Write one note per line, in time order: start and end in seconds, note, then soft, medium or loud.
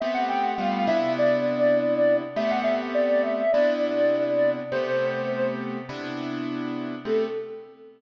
0.00 0.55 A3 loud
0.00 0.55 B3 loud
0.00 0.55 C4 loud
0.00 0.55 G4 loud
0.00 0.14 E5 loud
0.14 0.28 F#5 medium
0.29 0.43 G5 medium
0.43 0.57 F#5 loud
0.58 0.86 G3 loud
0.58 0.86 A3 loud
0.58 0.86 B3 loud
0.58 0.86 F4 loud
0.58 0.84 F5 loud
0.87 2.22 C3 loud
0.87 2.22 B3 loud
0.87 2.22 D4 loud
0.87 2.22 E4 loud
0.87 1.13 E5 loud
1.19 2.17 D5 medium
2.36 3.42 A3 loud
2.36 3.42 B3 loud
2.36 3.42 C4 loud
2.36 3.42 G4 loud
2.36 2.50 E5 medium
2.50 2.64 F#5 loud
2.63 2.77 E5 medium
2.94 3.21 D5 medium
3.23 3.51 E5 medium
3.52 4.60 C3 loud
3.52 4.60 B3 loud
3.52 4.60 D4 loud
3.52 4.60 E4 loud
3.52 4.50 D5 medium
4.72 5.78 C3 loud
4.72 5.78 A3 loud
4.72 5.78 B3 loud
4.72 5.78 G4 loud
4.72 5.47 C5 loud
5.89 6.95 C3 loud
5.89 6.95 B3 loud
5.89 6.95 D4 loud
5.89 6.95 E4 loud
7.05 7.26 A3 loud
7.05 7.26 B3 medium
7.05 7.26 C4 loud
7.05 7.26 G4 medium
7.05 7.27 A4 loud